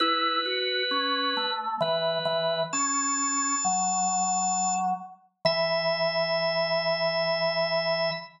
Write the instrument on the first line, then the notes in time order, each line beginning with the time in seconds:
drawbar organ
0.00 E4 B4
0.45 F#4
0.91 C#4
1.37 A3
1.80 E3 B4
2.25 E3
2.73 C#4 A5
3.65 F#3
5.45 E3 E5